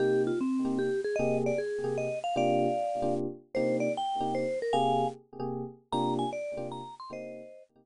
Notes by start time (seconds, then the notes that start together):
0.00 C3 A#3 D#4 G4
0.27 F4
0.41 C4
0.65 C3 A#3 D#4 G4
0.79 G4
1.04 G#4
1.16 C3 A#3 G4 G#4 D#5
1.46 D5
1.58 G#4
1.84 C3 A#3 G4 G#4
1.98 D#5
2.24 F5
2.36 C3 A#3 D4 F4 G4 D5 F5
3.02 C3 A#3 D4 F4 G4
3.55 C3 A#3 D#4 G4 C5
3.80 D5
3.97 G5
4.20 C3 A#3 D#4 G4
4.35 C5
4.62 A#4
4.73 C3 A#3 G4 G#4 F5 G#5
5.40 C3 A#3 G4 G#4
5.92 C3 A#3 D4 F4 G4 A#5
6.19 G#5
6.33 D5
6.57 C3 A#3 D4 F4 G4
6.72 A#5
7.00 C6
7.10 C3 A#3 D#4 G4 C5 D#5
7.76 C3 A#3 D#4 G4